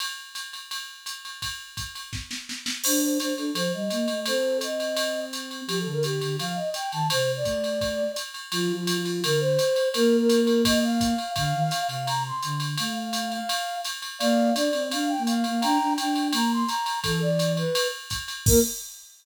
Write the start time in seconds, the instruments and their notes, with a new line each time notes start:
0.00 ride
0.35 hi-hat pedal, ride
0.53 ride
0.71 ride
1.06 hi-hat pedal, ride
1.25 ride
1.42 kick, ride
1.77 kick, hi-hat pedal, ride
1.95 ride
2.13 kick, snare
2.31 snare
2.49 snare
2.66 snare
2.83 flute D4 C5, crash, ride
3.01 flute C5
3.18 flute D4 C5, hi-hat pedal, ride
3.36 flute D4 A4, ride
3.54 flute F3 C5, ride
3.73 flute G3 D#5
3.90 flute A#3, hi-hat pedal, ride
4.08 flute A3, ride
4.26 flute C4 A4 C5, ride
4.61 flute D#5, hi-hat pedal, ride
4.80 ride
4.97 ride
5.33 hi-hat pedal, ride
5.51 ride
5.67 flute F3 G4, ride
5.80 flute A4
5.85 flute D3
5.92 flute A#4
6.03 flute G4, hi-hat pedal, ride
6.21 flute D3, ride
6.39 flute F3 F5, ride
6.55 flute D#5
6.74 flute G5, hi-hat pedal, ride
6.92 flute D#3 A5, ride
7.10 flute C3 C5, ride
7.36 flute D5
7.44 flute A3, kick, hi-hat pedal, ride
7.64 ride
7.81 kick, ride
8.16 hi-hat pedal, ride
8.34 ride
8.52 flute F3 F4, ride
8.72 flute F3
8.76 flute F4
8.87 flute F3, hi-hat pedal, ride
9.00 flute F4
9.05 ride
9.24 flute D3 A#4, ride
9.40 flute C5
9.59 hi-hat pedal, ride
9.76 ride
9.94 flute A#3 A#4, ride
10.19 flute A#4
10.29 hi-hat pedal, ride
10.41 flute A#4
10.47 ride
10.65 flute D#5, kick, ride
10.84 flute F5
11.01 kick, hi-hat pedal, ride
11.18 ride
11.36 flute D3 F5, kick, ride
11.54 flute D#3
11.60 flute F5
11.71 hi-hat pedal, ride
11.82 flute F5
11.88 flute C3, ride
12.06 flute A#5, ride
12.26 flute C6
12.43 flute D3, hi-hat pedal, ride
12.60 ride
12.77 flute A3 F5, ride
12.96 flute F5
13.13 hi-hat pedal, ride
13.31 flute F5, ride
13.49 ride
13.84 hi-hat pedal, ride
14.02 ride
14.19 flute A#3 D5 F5, ride
14.54 flute D4 D5, hi-hat pedal, ride
14.73 flute C4, ride
14.91 flute D4 F5, ride
15.08 flute G5
15.18 flute A#3
15.27 flute F5, hi-hat pedal, ride
15.44 flute A#3, ride
15.61 flute D4 G5 A#5, ride
15.79 flute D4
15.97 flute D4 G5, hi-hat pedal, ride
16.15 ride
16.32 flute A#3 A#5, ride
16.52 flute C6
16.67 flute A#5, hi-hat pedal, ride
16.86 ride
17.03 flute E3 A4, kick, ride
17.21 flute D5
17.39 hi-hat pedal, ride
17.57 flute B4, ride
17.75 ride
18.10 kick, hi-hat pedal, ride
18.28 hi-hat pedal, ride
18.46 flute A#3 A#4, kick, crash